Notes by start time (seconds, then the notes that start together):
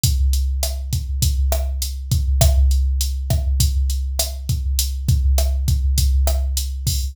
0.03 kick, closed hi-hat
0.33 closed hi-hat
0.63 cross-stick, closed hi-hat
0.93 kick, closed hi-hat
1.22 kick, closed hi-hat
1.52 cross-stick, closed hi-hat
1.82 closed hi-hat
2.11 kick, closed hi-hat
2.41 kick, cross-stick, closed hi-hat
2.71 closed hi-hat
3.01 closed hi-hat
3.30 kick, cross-stick, closed hi-hat
3.60 kick, closed hi-hat
3.90 closed hi-hat
4.19 cross-stick, closed hi-hat
4.49 kick, closed hi-hat
4.79 closed hi-hat
5.08 kick, closed hi-hat
5.38 cross-stick, closed hi-hat
5.68 kick, closed hi-hat
5.98 kick, closed hi-hat
6.27 cross-stick, closed hi-hat
6.57 closed hi-hat
6.87 kick, open hi-hat